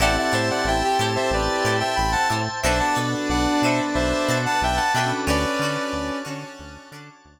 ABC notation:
X:1
M:4/4
L:1/16
Q:1/4=91
K:Dmix
V:1 name="Lead 2 (sawtooth)"
[df] [df] [ce] [df] [eg]2 z [ce] [Bd]3 [eg] [gb] [fa] z2 | [ce] [fa] z2 [df]2 [ce] z [ce]3 [fa] [eg] [fa] [eg] z | [Bd]6 z10 |]
V:2 name="Brass Section"
E E3 E G7 z4 | D12 z4 | ^C6 C4 z6 |]
V:3 name="Acoustic Guitar (steel)"
[EGAc]2 [EGAc]4 [EGAc]4 [EGAc]4 [EGAc]2 | [DFAB]2 [DFAB]4 [DFAB]4 [DFAB]4 [DFAB]2 | [^CDFA]2 [CDFA]4 [CDFA]4 [CDFA]4 z2 |]
V:4 name="Electric Piano 2"
[CEGA]16 | [B,DFA]14 [^CDFA]2- | [^CDFA]16 |]
V:5 name="Synth Bass 1" clef=bass
A,,,2 A,,2 A,,,2 A,,2 A,,,2 A,,2 A,,,2 A,,2 | B,,,2 B,,2 B,,,2 B,,2 B,,,2 B,,2 B,,,2 B,,2 | D,,2 D,2 D,,2 D,2 D,,2 D,2 D,,2 z2 |]
V:6 name="Drawbar Organ"
[cega]16 | [Bdfa]16 | [^cdfa]16 |]